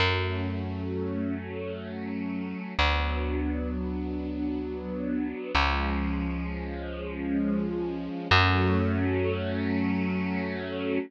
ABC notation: X:1
M:3/4
L:1/8
Q:1/4=65
K:F#m
V:1 name="String Ensemble 1"
[F,A,C]6 | [F,B,D]6 | [^E,G,C]6 | [F,A,C]6 |]
V:2 name="Electric Bass (finger)" clef=bass
F,,6 | D,,6 | C,,6 | F,,6 |]